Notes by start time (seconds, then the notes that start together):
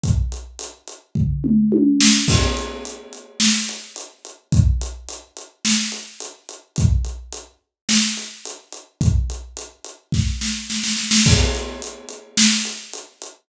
0.04 kick, closed hi-hat
0.32 closed hi-hat
0.59 closed hi-hat
0.88 closed hi-hat
1.15 kick, floor tom
1.44 mid tom
1.72 high tom
2.00 snare
2.28 kick, crash
2.57 closed hi-hat
2.85 closed hi-hat
3.13 closed hi-hat
3.40 snare
3.69 closed hi-hat
3.96 closed hi-hat
4.25 closed hi-hat
4.52 kick, closed hi-hat
4.81 closed hi-hat
5.09 closed hi-hat
5.37 closed hi-hat
5.65 snare
5.92 closed hi-hat
6.20 closed hi-hat
6.49 closed hi-hat
6.76 kick, closed hi-hat
7.05 closed hi-hat
7.32 closed hi-hat
7.89 snare, closed hi-hat
8.17 closed hi-hat
8.45 closed hi-hat
8.72 closed hi-hat
9.01 kick, closed hi-hat
9.30 closed hi-hat
9.57 closed hi-hat
9.84 closed hi-hat
10.12 kick, snare
10.41 snare
10.70 snare
10.83 snare
10.97 snare
11.11 snare
11.26 kick, crash
11.55 closed hi-hat
11.82 closed hi-hat
12.09 closed hi-hat
12.37 snare
12.65 closed hi-hat
12.93 closed hi-hat
13.22 closed hi-hat